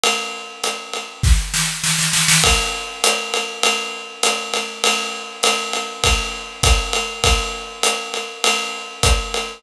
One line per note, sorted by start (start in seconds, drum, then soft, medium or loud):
0.04 ride loud
0.64 hi-hat pedal medium
0.64 ride medium
0.93 ride medium
1.23 kick medium
1.23 snare medium
1.54 snare medium
1.84 snare medium
1.99 snare medium
2.13 snare medium
2.28 snare medium
2.44 kick medium
2.44 ride loud
3.04 hi-hat pedal loud
3.04 ride loud
3.34 ride medium
3.63 ride loud
4.23 hi-hat pedal medium
4.23 ride loud
4.54 ride medium
4.84 ride loud
5.43 hi-hat pedal medium
5.43 ride loud
5.73 ride medium
6.04 kick medium
6.04 ride loud
6.63 kick medium
6.63 hi-hat pedal medium
6.63 ride loud
6.93 ride medium
7.24 kick medium
7.24 ride loud
7.83 hi-hat pedal medium
7.83 ride medium
8.14 ride medium
8.44 ride loud
9.03 kick medium
9.03 hi-hat pedal medium
9.03 ride medium
9.34 ride medium